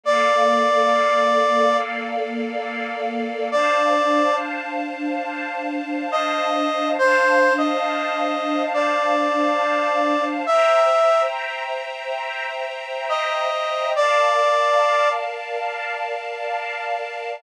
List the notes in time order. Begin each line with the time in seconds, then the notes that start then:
0.03 A#3 A4 D5 F5
3.51 D4 C5 D5 F5 A5
6.12 D#5
6.99 D4 C5 F5 A5
7.58 D#5
8.74 D5
10.46 C5 E5 G5 A#5
13.09 D#5
13.95 A#4 D5 F5 A5